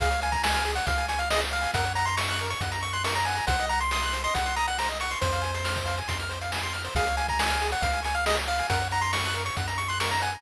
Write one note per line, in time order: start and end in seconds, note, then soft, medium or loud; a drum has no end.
0.00 0.80 C#2 medium
0.00 0.10 G#4 loud
0.00 0.20 F5 medium
0.00 kick loud
0.00 closed hi-hat loud
0.11 0.20 C#5 medium
0.11 closed hi-hat medium
0.21 0.31 F5 medium
0.21 0.33 G#5 medium
0.21 closed hi-hat loud
0.32 0.43 G#5 medium
0.32 0.42 A#5 medium
0.32 kick loud
0.32 closed hi-hat medium
0.43 0.72 G#5 medium
0.43 0.54 C#6 medium
0.43 snare loud
0.54 0.64 F6 medium
0.54 closed hi-hat medium
0.65 0.75 G#4 medium
0.65 closed hi-hat medium
0.75 0.87 C#5 medium
0.75 0.86 F#5 medium
0.75 closed hi-hat medium
0.86 1.67 C#2 medium
0.86 0.95 F5 medium
0.86 1.06 F5 medium
0.86 kick loud
0.86 closed hi-hat loud
0.98 1.08 G#5 medium
0.98 closed hi-hat medium
1.08 1.19 G#5 medium
1.08 1.18 C#6 medium
1.08 closed hi-hat loud
1.19 1.29 F5 medium
1.19 1.30 F6 medium
1.19 closed hi-hat medium
1.30 1.42 G#4 medium
1.30 1.41 D#5 medium
1.30 snare loud
1.41 1.51 C#5 medium
1.41 closed hi-hat medium
1.51 1.61 F5 medium
1.51 1.71 F5 medium
1.61 1.71 G#5 medium
1.61 closed hi-hat medium
1.74 2.55 F#2 medium
1.74 1.85 A#4 loud
1.74 1.93 F#5 medium
1.74 kick loud
1.74 closed hi-hat loud
1.85 1.95 C#5 medium
1.85 closed hi-hat medium
1.95 2.06 F#5 medium
1.95 2.06 A#5 medium
1.95 closed hi-hat medium
2.06 2.17 A#5 medium
2.06 2.16 C6 medium
2.06 closed hi-hat medium
2.17 2.47 C#6 medium
2.17 2.27 C#6 medium
2.17 snare loud
2.28 2.39 F#6 medium
2.28 closed hi-hat medium
2.39 2.51 A#4 medium
2.39 closed hi-hat medium
2.50 2.60 C#5 medium
2.50 2.61 C#6 medium
2.50 closed hi-hat medium
2.61 3.41 F#2 medium
2.61 2.71 F#5 medium
2.61 kick loud
2.61 closed hi-hat loud
2.72 2.81 A#5 loud
2.72 closed hi-hat loud
2.81 2.91 C#6 medium
2.81 2.93 C#6 medium
2.81 closed hi-hat medium
2.93 3.04 C6 medium
2.93 3.03 F#6 medium
2.93 closed hi-hat medium
3.04 3.14 A#4 medium
3.04 3.15 C#6 medium
3.04 snare loud
3.15 3.25 C#5 medium
3.15 3.26 A#5 medium
3.15 closed hi-hat medium
3.25 3.37 F#5 medium
3.25 3.46 G#5 medium
3.25 closed hi-hat medium
3.35 3.45 A#5 medium
3.35 closed hi-hat medium
3.47 4.28 C2 medium
3.47 3.57 C5 loud
3.47 3.66 F#5 medium
3.47 kick loud
3.47 closed hi-hat loud
3.59 3.69 D#5 medium
3.59 closed hi-hat medium
3.69 3.80 F#5 medium
3.69 3.80 A#5 medium
3.69 closed hi-hat medium
3.80 3.91 C6 medium
3.80 closed hi-hat medium
3.91 4.22 C6 medium
3.91 4.02 D#6 medium
3.91 snare loud
4.02 4.13 F#6 medium
4.02 closed hi-hat medium
4.13 4.23 C5 medium
4.13 closed hi-hat loud
4.24 4.34 D#5 medium
4.24 4.34 C6 medium
4.24 closed hi-hat medium
4.34 5.16 C2 medium
4.34 4.44 F#5 medium
4.34 4.55 F#5 medium
4.34 kick loud
4.34 closed hi-hat loud
4.46 4.56 C6 medium
4.46 closed hi-hat medium
4.56 4.67 A#5 medium
4.56 4.66 D#6 medium
4.56 closed hi-hat medium
4.68 4.78 F#5 medium
4.68 4.77 F#6 medium
4.68 closed hi-hat medium
4.78 4.90 C5 medium
4.78 4.89 A#5 medium
4.78 snare loud
4.88 4.98 D#5 medium
4.88 closed hi-hat medium
5.00 5.11 F#5 medium
5.00 5.19 C#6 medium
5.00 closed hi-hat loud
5.11 5.21 C6 medium
5.11 closed hi-hat medium
5.21 6.02 F2 medium
5.21 6.00 C5 medium
5.21 5.32 C5 loud
5.21 kick loud
5.21 closed hi-hat loud
5.32 5.42 F5 medium
5.32 closed hi-hat medium
5.42 5.51 G#5 medium
5.42 closed hi-hat medium
5.54 5.64 C6 medium
5.54 closed hi-hat loud
5.64 5.74 F6 medium
5.64 snare loud
5.76 5.86 C5 medium
5.76 kick loud
5.76 closed hi-hat medium
5.86 5.95 F5 medium
5.86 closed hi-hat medium
5.98 6.08 G#5 medium
5.98 closed hi-hat medium
6.08 6.89 F2 medium
6.08 6.17 C6 medium
6.08 kick loud
6.08 closed hi-hat loud
6.19 6.30 F6 medium
6.19 closed hi-hat medium
6.29 6.39 C5 medium
6.29 closed hi-hat medium
6.41 6.51 F5 medium
6.41 closed hi-hat medium
6.52 6.62 G#5 medium
6.52 snare loud
6.63 6.73 C6 medium
6.63 closed hi-hat medium
6.73 6.82 F6 medium
6.73 closed hi-hat medium
6.84 6.94 C5 medium
6.84 closed hi-hat medium
6.95 7.75 C#2 medium
6.95 7.05 G#4 loud
6.95 7.16 F5 medium
6.95 kick loud
6.95 closed hi-hat loud
7.06 7.17 C#5 medium
7.06 closed hi-hat medium
7.17 7.26 F5 medium
7.17 7.27 G#5 medium
7.17 closed hi-hat loud
7.28 7.38 G#5 medium
7.28 7.40 A#5 medium
7.28 kick loud
7.28 closed hi-hat medium
7.39 7.68 G#5 medium
7.39 7.50 C#6 medium
7.39 snare loud
7.48 7.58 F6 medium
7.48 closed hi-hat medium
7.61 7.71 G#4 medium
7.61 closed hi-hat medium
7.72 7.82 C#5 medium
7.72 7.83 F#5 medium
7.72 closed hi-hat medium
7.81 8.62 C#2 medium
7.81 7.91 F5 medium
7.81 8.01 F5 medium
7.81 kick loud
7.81 closed hi-hat loud
7.93 8.03 G#5 medium
7.93 closed hi-hat medium
8.03 8.16 G#5 medium
8.03 8.12 C#6 medium
8.03 closed hi-hat loud
8.15 8.25 F5 medium
8.15 8.24 F6 medium
8.15 closed hi-hat medium
8.26 8.36 G#4 medium
8.26 8.37 D#5 medium
8.26 snare loud
8.37 8.47 C#5 medium
8.37 closed hi-hat medium
8.47 8.57 F5 medium
8.47 8.67 F5 medium
8.59 8.69 G#5 medium
8.59 closed hi-hat medium
8.70 9.50 F#2 medium
8.70 8.79 A#4 loud
8.70 8.88 F#5 medium
8.70 kick loud
8.70 closed hi-hat loud
8.80 8.92 C#5 medium
8.80 closed hi-hat medium
8.91 9.00 F#5 medium
8.91 9.03 A#5 medium
8.91 closed hi-hat medium
9.01 9.13 A#5 medium
9.01 9.12 C6 medium
9.01 closed hi-hat medium
9.13 9.22 C#6 medium
9.13 9.43 C#6 medium
9.13 snare loud
9.24 9.35 F#6 medium
9.24 closed hi-hat medium
9.34 9.44 A#4 medium
9.34 closed hi-hat medium
9.45 9.55 C#5 medium
9.45 9.56 C#6 medium
9.45 closed hi-hat medium
9.57 10.37 F#2 medium
9.57 9.67 F#5 medium
9.57 kick loud
9.57 closed hi-hat loud
9.68 9.77 A#5 loud
9.68 closed hi-hat loud
9.78 9.88 C#6 medium
9.78 closed hi-hat medium
9.88 9.99 C6 medium
9.88 9.99 F#6 medium
9.88 closed hi-hat medium
10.00 10.10 A#4 medium
10.00 10.11 C#6 medium
10.00 snare loud
10.10 10.20 C#5 medium
10.10 10.21 A#5 medium
10.10 closed hi-hat medium
10.22 10.31 F#5 medium
10.22 10.42 G#5 medium
10.22 closed hi-hat medium
10.33 10.42 A#5 medium
10.33 closed hi-hat medium